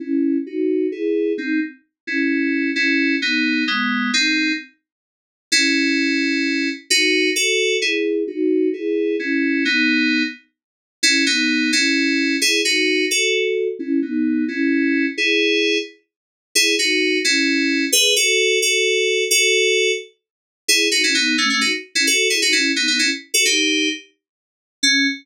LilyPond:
\new Staff { \time 6/8 \key cis \minor \tempo 4. = 87 <cis' e'>4 <dis' fis'>4 <e' gis'>4 | <bis dis'>8 r4 <cis' e'>4. | <cis' e'>4 <b dis'>4 <gis b>4 | <bis dis'>4 r2 |
\key e \major <cis' e'>2. | <dis' fis'>4 <fis' a'>4 <e' gis'>4 | <dis' fis'>4 <e' gis'>4 <cis' e'>4 | <b dis'>4. r4. |
\key cis \minor <cis' e'>8 <b dis'>4 <cis' e'>4. | <e' gis'>8 <dis' fis'>4 <fis' a'>4. | <cis' e'>8 <b dis'>4 <cis' e'>4. | <e' gis'>4. r4. |
\key e \major <e' gis'>8 <dis' fis'>4 <cis' e'>4. | <gis' b'>8 <fis' a'>4 <fis' a'>4. | <fis' a'>4. r4. | \key cis \minor <e' gis'>8 <dis' fis'>16 <cis' e'>16 <b dis'>8 <a cis'>16 <a cis'>16 <dis' fis'>16 r8 <cis' e'>16 |
<fis' a'>8 <e' gis'>16 <dis' fis'>16 <cis' e'>8 <b dis'>16 <b dis'>16 <cis' e'>16 r8 <fis' a'>16 | <dis' g'>4 r2 | cis'4. r4. | }